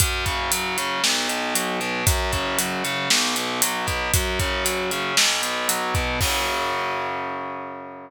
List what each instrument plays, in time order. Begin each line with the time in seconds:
0.00 overdriven guitar F#2, kick, closed hi-hat
0.26 overdriven guitar C#3, kick, closed hi-hat
0.51 overdriven guitar F#3, closed hi-hat
0.78 overdriven guitar C#3, closed hi-hat
1.04 overdriven guitar B1, snare
1.28 overdriven guitar B2, closed hi-hat
1.55 overdriven guitar F#3, closed hi-hat
1.80 overdriven guitar B2, closed hi-hat
2.06 overdriven guitar F#2, kick, closed hi-hat
2.32 overdriven guitar C#3, kick, closed hi-hat
2.59 overdriven guitar F#3, closed hi-hat
2.84 overdriven guitar C#3, closed hi-hat
3.10 overdriven guitar B1, snare
3.36 overdriven guitar B2, closed hi-hat
3.62 overdriven guitar F#3, closed hi-hat
3.87 overdriven guitar B2, kick, closed hi-hat
4.14 overdriven guitar F#2, kick, closed hi-hat
4.40 overdriven guitar C#3, kick, closed hi-hat
4.65 overdriven guitar F#3, closed hi-hat
4.91 overdriven guitar C#3, closed hi-hat
5.17 overdriven guitar B1, snare
5.42 overdriven guitar B2, closed hi-hat
5.69 overdriven guitar F#3, closed hi-hat
5.95 overdriven guitar B2, kick, closed hi-hat
6.21 overdriven guitar F#2 C#3 F#3, kick, crash